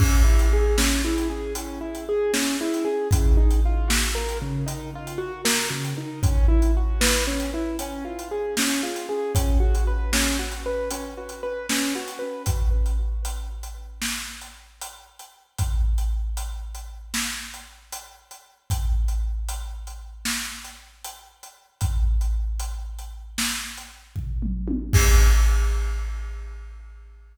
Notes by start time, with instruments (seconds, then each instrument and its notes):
0.00 acoustic grand piano C#4, kick, crash
0.24 acoustic grand piano E4
0.39 closed hi-hat
0.53 acoustic grand piano G#4
0.78 acoustic grand piano C#4, snare
1.05 acoustic grand piano E4
1.18 closed hi-hat
1.30 acoustic grand piano G#4
1.55 acoustic grand piano C#4, closed hi-hat
1.81 acoustic grand piano E4
1.95 closed hi-hat
2.09 acoustic grand piano G#4
2.34 acoustic grand piano C#4, snare
2.61 acoustic grand piano E4
2.74 closed hi-hat
2.85 acoustic grand piano G#4
3.11 acoustic grand piano C#3, kick, closed hi-hat
3.37 acoustic grand piano D#4
3.51 closed hi-hat
3.65 acoustic grand piano F4
3.88 acoustic grand piano F#4, snare
4.15 acoustic grand piano A#4
4.29 closed hi-hat
4.42 acoustic grand piano C#3
4.66 acoustic grand piano D#4, closed hi-hat
4.95 acoustic grand piano F4
5.07 closed hi-hat
5.18 acoustic grand piano F#4
5.45 acoustic grand piano A#4, snare
5.71 acoustic grand piano C#3
5.85 closed hi-hat
5.98 acoustic grand piano D#4
6.23 acoustic grand piano C#4, kick, closed hi-hat
6.48 acoustic grand piano E4
6.62 closed hi-hat
6.77 acoustic grand piano F#4
7.01 acoustic grand piano B4, snare
7.27 acoustic grand piano C#4
7.40 closed hi-hat
7.54 acoustic grand piano E4
7.79 acoustic grand piano C#4, closed hi-hat
8.05 acoustic grand piano F4
8.19 closed hi-hat
8.31 acoustic grand piano G#4
8.57 acoustic grand piano C#4, snare
8.83 acoustic grand piano F4
8.96 closed hi-hat
9.09 acoustic grand piano G#4
9.35 acoustic grand piano C#4, kick, closed hi-hat
9.60 acoustic grand piano F#4
9.75 closed hi-hat
9.87 acoustic grand piano B4
10.13 acoustic grand piano C#4, snare
10.39 acoustic grand piano F#4
10.52 closed hi-hat
10.66 acoustic grand piano B4
10.90 acoustic grand piano C#4, closed hi-hat
11.17 acoustic grand piano F#4
11.29 closed hi-hat
11.43 acoustic grand piano B4
11.69 acoustic grand piano C#4, snare
11.96 acoustic grand piano F#4
12.08 closed hi-hat
12.19 acoustic grand piano B4
12.46 kick, closed hi-hat
12.86 closed hi-hat
13.25 closed hi-hat
13.63 closed hi-hat
14.02 snare
14.41 closed hi-hat
14.81 closed hi-hat
15.19 closed hi-hat
15.58 kick, closed hi-hat
15.98 closed hi-hat
16.37 closed hi-hat
16.75 closed hi-hat
17.14 snare
17.54 closed hi-hat
17.92 closed hi-hat
18.31 closed hi-hat
18.70 kick, closed hi-hat
19.08 closed hi-hat
19.49 closed hi-hat
19.87 closed hi-hat
20.25 snare
20.64 closed hi-hat
21.04 closed hi-hat
21.43 closed hi-hat
21.81 kick, closed hi-hat
22.21 closed hi-hat
22.60 closed hi-hat
22.99 closed hi-hat
23.38 snare
23.77 closed hi-hat
24.16 kick, floor tom
24.42 mid tom
24.68 high tom
24.93 kick, crash